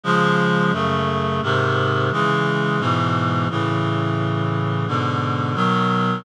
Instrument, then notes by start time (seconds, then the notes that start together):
clarinet
0.03 C#3 F3 G#3
0.73 F#2 C#3 A3
1.42 G#2 C3 D#3
2.12 C#3 E3 G#3
2.79 G#2 B2 E3
3.50 A2 C#3 E3
4.87 G#2 B2 D3
5.55 B2 D#3 F#3